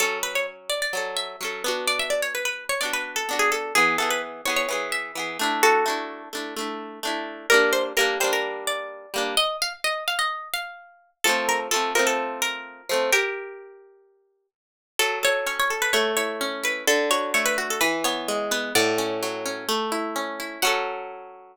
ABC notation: X:1
M:4/4
L:1/16
Q:1/4=128
K:F#m
V:1 name="Acoustic Guitar (steel)"
A2 B c z2 d d3 e6 | d e d c B B2 c d B2 A2 G A2 | G2 A B z2 c c3 e6 | [FA]6 z10 |
[K:Gm] B2 c z B2 c B3 d6 | e2 f z e2 f e3 f6 | A2 B z A2 B A3 B6 | [GB]12 z4 |
[K:F#m] A2 c2 c c z B c2 c4 B2 | A2 c2 c B z A B2 c4 B2 | [df]8 z8 | f16 |]
V:2 name="Acoustic Guitar (steel)"
[F,C]8 [F,CA]4 [F,CA]2 [B,DF]2- | [B,DF]8 [B,DF]4 [B,DF]4 | [E,B,]2 [E,B,G]4 [E,B,G]2 [E,B,G]4 [E,B,G]2 [A,DE]2- | [A,DE]2 [A,DE]4 [A,DE]2 [A,DE]4 [A,DE]4 |
[K:Gm] [G,B,D]4 [G,B,D]2 [G,B,D]8 [G,B,D]2 | z16 | [F,A,C]4 [F,A,C]2 [F,A,C]8 [F,A,C]2 | z16 |
[K:F#m] F,2 A2 C2 A2 A,2 E2 C2 E2 | D,2 F2 A,2 F2 E,2 B,2 G,2 B,2 | A,,2 C2 F,2 C2 A,2 E2 C2 E2 | [F,CA]16 |]